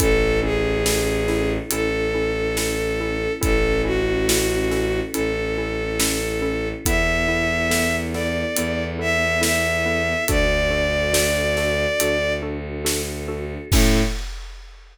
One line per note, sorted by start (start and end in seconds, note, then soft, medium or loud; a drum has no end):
0.00 1.58 A1 medium
0.00 0.17 C#4 loud
0.00 3.40 C#4 loud
0.00 0.17 E4 loud
0.00 3.40 E4 loud
0.00 0.40 A4 loud
0.00 0.17 A4 medium
0.00 3.40 A4 medium
0.00 kick medium
0.00 closed hi-hat medium
0.42 0.59 C#4 medium
0.42 0.59 E4 medium
0.42 1.51 G#4 loud
0.42 0.59 A4 medium
0.86 1.03 C#4 medium
0.86 1.03 E4 medium
0.86 1.03 A4 medium
0.86 snare loud
1.28 1.46 C#4 medium
1.28 1.46 E4 medium
1.28 1.46 A4 medium
1.28 snare soft
1.69 3.27 A1 medium
1.69 1.89 C#4 medium
1.69 1.89 E4 medium
1.69 3.33 A4 loud
1.69 1.89 A4 medium
1.69 closed hi-hat medium
2.14 2.32 C#4 medium
2.14 2.32 E4 medium
2.14 2.32 A4 medium
2.57 2.75 C#4 medium
2.57 2.75 E4 medium
2.57 2.75 A4 medium
2.57 snare medium
3.01 3.18 C#4 medium
3.01 3.18 E4 medium
3.01 3.18 A4 medium
3.41 5.01 A1 medium
3.41 3.59 C#4 medium
3.41 6.82 C#4 loud
3.41 3.59 E4 medium
3.41 6.82 E4 loud
3.41 3.59 A4 medium
3.41 3.82 A4 loud
3.41 6.82 A4 medium
3.41 kick medium
3.41 closed hi-hat medium
3.84 4.01 C#4 medium
3.84 4.01 E4 medium
3.84 5.00 F#4 loud
3.84 4.01 A4 medium
4.29 4.46 C#4 medium
4.29 4.46 E4 medium
4.29 4.46 A4 medium
4.29 snare loud
4.71 4.88 C#4 medium
4.71 4.88 E4 medium
4.71 4.88 A4 medium
4.71 snare medium
5.13 6.73 A1 medium
5.13 5.32 C#4 medium
5.13 5.32 E4 medium
5.13 6.68 A4 loud
5.13 5.32 A4 medium
5.13 closed hi-hat medium
5.58 5.75 C#4 medium
5.58 5.75 E4 medium
5.58 5.75 A4 medium
6.00 6.17 C#4 medium
6.00 6.17 E4 medium
6.00 6.17 A4 medium
6.00 snare loud
6.42 6.59 C#4 medium
6.42 6.59 E4 medium
6.42 6.59 A4 medium
6.85 8.44 E2 medium
6.85 10.25 B3 loud
6.85 7.03 B3 loud
6.85 10.25 E4 loud
6.85 7.03 E4 medium
6.85 10.25 A4 loud
6.85 7.03 A4 medium
6.85 7.96 E5 loud
6.85 kick medium
6.85 closed hi-hat medium
7.28 7.46 B3 medium
7.28 7.46 E4 medium
7.28 7.46 A4 medium
7.71 7.88 B3 medium
7.71 7.88 E4 medium
7.71 7.88 A4 medium
7.71 snare medium
8.14 8.32 B3 medium
8.14 8.32 E4 medium
8.14 8.32 A4 medium
8.14 8.84 D5 medium
8.14 snare soft
8.56 10.14 E2 medium
8.56 8.75 B3 medium
8.56 8.75 E4 medium
8.56 8.75 A4 medium
8.56 closed hi-hat medium
8.99 9.16 B3 medium
8.99 9.16 E4 medium
8.99 9.16 A4 medium
8.99 9.41 E5 loud
9.41 9.59 B3 medium
9.41 9.59 E4 medium
9.41 9.59 A4 medium
9.41 10.24 E5 loud
9.41 snare loud
9.86 10.03 B3 medium
9.86 10.03 E4 medium
9.86 10.03 A4 medium
10.28 11.86 D2 medium
10.28 10.46 D4 medium
10.28 13.68 D4 medium
10.28 10.46 F#4 medium
10.28 13.68 F#4 loud
10.28 10.46 A4 medium
10.28 13.68 A4 loud
10.28 12.33 D5 loud
10.28 kick medium
10.28 closed hi-hat medium
10.71 10.88 D4 medium
10.71 10.88 F#4 medium
10.71 10.88 A4 medium
11.13 11.31 D4 medium
11.13 11.31 F#4 medium
11.13 11.31 A4 medium
11.13 snare loud
11.57 11.74 D4 medium
11.57 11.74 F#4 medium
11.57 11.74 A4 medium
11.57 snare medium
12.00 13.57 D2 medium
12.00 12.18 D4 medium
12.00 12.18 F#4 medium
12.00 12.18 A4 medium
12.00 closed hi-hat loud
12.43 12.60 D4 medium
12.43 12.60 F#4 medium
12.43 12.60 A4 medium
12.85 13.02 D4 medium
12.85 13.02 F#4 medium
12.85 13.02 A4 medium
12.85 snare loud
13.28 13.45 D4 medium
13.28 13.45 F#4 medium
13.28 13.45 A4 medium
13.71 14.03 A2 loud
13.71 14.01 C#4 medium
13.71 14.03 C#4 loud
13.71 14.01 E4 loud
13.71 14.03 E4 loud
13.71 14.01 A4 medium
13.71 14.02 A4 loud
13.71 14.03 A4 loud
13.71 kick loud
13.71 crash loud